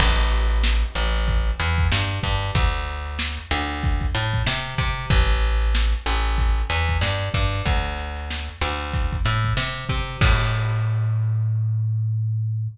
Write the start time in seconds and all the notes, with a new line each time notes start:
0.00 A1, kick, crash
0.18 snare, closed hi-hat
0.31 closed hi-hat
0.50 closed hi-hat
0.64 snare
0.83 closed hi-hat
0.95 A1, snare, closed hi-hat
1.14 snare, closed hi-hat
1.27 kick, closed hi-hat
1.47 closed hi-hat
1.60 E2, closed hi-hat
1.78 kick, closed hi-hat
1.92 G2, snare
2.10 closed hi-hat
2.23 G2, kick, snare, closed hi-hat
2.42 snare, closed hi-hat
2.55 D2, kick, closed hi-hat
2.74 closed hi-hat
2.88 closed hi-hat
3.06 closed hi-hat
3.19 snare
3.38 snare, closed hi-hat
3.51 D2, snare, closed hi-hat
3.69 closed hi-hat
3.83 kick, closed hi-hat
4.01 kick, closed hi-hat
4.15 A2, closed hi-hat
4.34 kick, closed hi-hat
4.47 C3, snare
4.66 closed hi-hat
4.78 C3, kick, closed hi-hat
4.97 closed hi-hat
5.10 A1, kick, closed hi-hat
5.29 closed hi-hat
5.43 closed hi-hat
5.61 snare, closed hi-hat
5.75 snare
5.93 closed hi-hat
6.06 A1, snare, closed hi-hat
6.24 closed hi-hat
6.38 kick, closed hi-hat
6.57 closed hi-hat
6.70 E2, closed hi-hat
6.89 kick, closed hi-hat
7.01 G2, snare
7.21 closed hi-hat
7.34 G2, kick, closed hi-hat
7.52 snare, closed hi-hat
7.66 D2, kick, closed hi-hat
7.84 closed hi-hat
7.97 snare, closed hi-hat
8.16 closed hi-hat
8.30 snare
8.49 closed hi-hat
8.61 D2, snare, closed hi-hat
8.80 closed hi-hat
8.93 kick, closed hi-hat
9.13 kick, closed hi-hat
9.25 A2, closed hi-hat
9.44 kick, closed hi-hat
9.57 C3, snare
9.76 closed hi-hat
9.89 C3, kick, closed hi-hat
10.08 closed hi-hat
10.21 A2, kick, crash